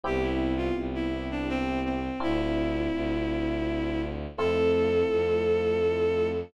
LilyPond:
<<
  \new Staff \with { instrumentName = "Violin" } { \time 3/4 \key a \minor \tempo 4 = 83 g'16 e'8 f'16 r16 e'8 d'16 c'8 c'8 | e'2. | a'2. | }
  \new Staff \with { instrumentName = "Electric Piano 1" } { \time 3/4 \key a \minor <b c' e' g'>2. | <c' d' e' f'>2. | <a c' e' f'>2. | }
  \new Staff \with { instrumentName = "Violin" } { \clef bass \time 3/4 \key a \minor c,4 c,2 | d,4 d,2 | f,4 f,2 | }
>>